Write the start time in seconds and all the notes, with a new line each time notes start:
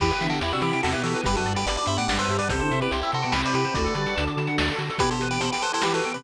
0.00 E2 E3 B3 E4 G4 B4, kick, crash
0.11 B4, closed hi-hat
0.21 D3 E3 D4 E5, closed hi-hat
0.30 F#4 A4 G5, closed hi-hat
0.41 E2 E4 G4 B5, closed hi-hat
0.52 C3 C4 D4 F#4 E6, closed hi-hat
0.61 E3 E4 G4 B5, closed hi-hat
0.72 C3 C4 G5, closed hi-hat
0.83 E2 C3 C4 F#4 A4 E5, snare
0.92 B2 B3 E4 G4 B4, closed hi-hat
1.03 E3 F#4 G4 A4, closed hi-hat
1.14 B4, closed hi-hat
1.24 G1 G2 G3 B3 D4 G4 B4, kick, closed hi-hat
1.35 F#2 F#3 F#4 A4 B4, closed hi-hat
1.45 G2 G3 D5, closed hi-hat
1.56 G4 B4 G5, closed hi-hat
1.66 G1 B4 D5 B5, closed hi-hat
1.76 B4 D5 D6, closed hi-hat
1.86 G2 C5 E5 B5, closed hi-hat
1.97 A2 A3 D5 F#5 G5, closed hi-hat
2.08 G1 G2 G3 D5 F#5, snare
2.18 B4 C5 E5, closed hi-hat
2.29 G2 G4, closed hi-hat
2.39 B4 D5, closed hi-hat
2.49 C2 C3 C4 E4 G4 A4 C5, kick, closed hi-hat
2.59 D3 D4 C5, closed hi-hat
2.71 C3 C4 E5, closed hi-hat
2.81 G4 B4 G5, closed hi-hat
2.91 C2 E4 G4 C6, closed hi-hat
3.01 E4 G4 E6, closed hi-hat
3.12 C3 F#4 A4 C6, closed hi-hat
3.22 B2 B3 G5, closed hi-hat
3.32 C2 C3 C4 G4 B4 E5, snare
3.43 B4 C5 D5, closed hi-hat
3.54 C3 G4 B4, closed hi-hat
3.64 C5, closed hi-hat
3.74 D2 A3 D4 F#4 A4 B4 D5, kick, closed hi-hat
3.84 A4, closed hi-hat
3.95 D3 G3 G4 D5, closed hi-hat
4.06 F#5, closed hi-hat
4.16 D2 D3 D4 A5, closed hi-hat
4.27 D6, closed hi-hat
4.37 D3 A5, closed hi-hat
4.47 F#5, closed hi-hat
4.58 D2 D5, snare
4.68 A4, closed hi-hat
4.79 D3 F#4, closed hi-hat
4.89 A4, closed hi-hat
4.98 B2 E3 B3 E4 G4 B4, kick, closed hi-hat
5.11 G4 A4 C5, closed hi-hat
5.21 B4, closed hi-hat
5.31 G4 B4 G5, closed hi-hat
5.40 B2 B3 A4 C5 B5, closed hi-hat
5.52 G4 B4 G5, closed hi-hat
5.62 A4 B4 C5, closed hi-hat
5.73 E4 A4 C5, closed hi-hat
5.82 E3 E4 G4 B4, snare
5.94 F#4 A4 B4, closed hi-hat
6.04 G5, closed hi-hat
6.14 C3 C4 G4 B4 B5, closed hi-hat